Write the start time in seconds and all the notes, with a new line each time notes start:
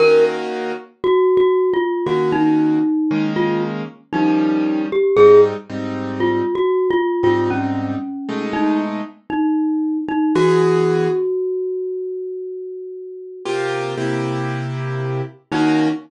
0.00 D#3 A#3 C#4 F#4 A#4
1.04 F#4
1.37 F#4
1.73 F4
2.06 D#3 A#3 C#4 F#4
2.32 D#4
3.11 D#3 G#3 A#3 C#4
3.36 F4
4.13 D#3 F3 G3 C#4 D#4
4.92 G4
5.17 G#2 G3 C4 D#4 G#4
5.70 G#2 G3 C4 D#4
6.20 F4
6.55 F#4
6.91 F4
7.23 G#2 G3 C4 D#4 F4
7.50 C#4
8.29 B2 G#3 A3 D#4
8.53 D#4
9.30 D#4
10.08 D#4
10.35 E3 B3 F#4 G#4
13.45 C3 A#3 F4 G4
13.97 C3 A#3 E4 G4
15.52 D#3 A#3 C#4 D#4 F#4